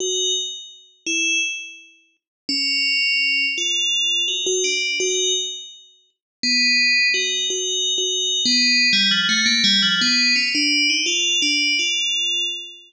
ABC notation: X:1
M:7/8
L:1/16
Q:1/4=84
K:none
V:1 name="Tubular Bells"
_G2 z4 E2 z6 | _D6 F4 _G G =D2 | _G2 z6 B,4 G2 | (3_G4 G4 B,4 =G, F, A, _B, G, F, |
B,2 _D =D2 _E F2 D2 F4 |]